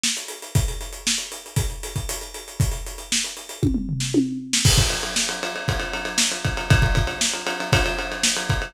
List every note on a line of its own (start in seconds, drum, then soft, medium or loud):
0.04 snare medium
0.17 closed hi-hat medium
0.28 closed hi-hat medium
0.42 closed hi-hat medium
0.55 kick medium
0.55 closed hi-hat medium
0.68 closed hi-hat medium
0.81 closed hi-hat medium
0.93 closed hi-hat medium
1.07 snare medium
1.18 closed hi-hat medium
1.32 closed hi-hat medium
1.46 closed hi-hat medium
1.56 kick medium
1.56 closed hi-hat medium
1.70 closed hi-hat soft
1.83 closed hi-hat medium
1.96 kick medium
1.96 closed hi-hat medium
2.09 closed hi-hat medium
2.21 closed hi-hat medium
2.34 closed hi-hat medium
2.48 closed hi-hat medium
2.60 kick medium
2.60 closed hi-hat medium
2.71 closed hi-hat medium
2.87 closed hi-hat medium
2.98 closed hi-hat medium
3.12 snare medium
3.24 closed hi-hat medium
3.37 closed hi-hat medium
3.49 closed hi-hat medium
3.63 kick medium
3.63 high tom medium
3.74 mid tom medium
3.89 floor tom medium
4.00 snare medium
4.14 high tom medium
4.53 snare medium
4.65 kick medium
4.65 crash loud
4.78 kick medium
4.78 ride medium
4.90 ride medium
5.03 ride medium
5.16 snare medium
5.29 ride medium
5.43 ride medium
5.56 ride medium
5.68 kick medium
5.68 ride medium
5.80 ride medium
5.93 ride medium
6.05 ride medium
6.18 snare loud
6.32 ride medium
6.45 kick medium
6.45 ride medium
6.57 ride medium
6.70 kick loud
6.70 ride medium
6.82 kick medium
6.82 ride medium
6.95 kick medium
6.95 ride medium
7.07 ride medium
7.21 snare medium
7.33 ride medium
7.47 ride medium
7.60 ride medium
7.73 kick medium
7.73 ride loud
7.86 ride medium
7.99 ride medium
8.12 ride medium
8.23 snare medium
8.37 ride medium
8.50 kick medium
8.50 ride medium
8.62 ride medium